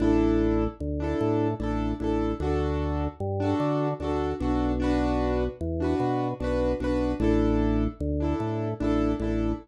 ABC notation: X:1
M:6/8
L:1/16
Q:3/8=50
K:A
V:1 name="Acoustic Grand Piano"
[DEA]5 [DEA]3 [DEA]2 [DEA]2 | [DFA]5 [DFA]3 [DFA]2 [DFA]2 | [DFB]5 [DFB]3 [DFB]2 [DFB]2 | [DEA]5 [DEA]3 [DEA]2 [DEA]2 |]
V:2 name="Drawbar Organ" clef=bass
A,,,4 D,,2 A,,2 A,,,2 A,,,2 | D,,4 =G,,2 D,2 D,,2 B,,,2- | B,,,4 E,,2 B,,2 B,,,2 B,,,2 | A,,,4 D,,2 A,,2 A,,,2 A,,,2 |]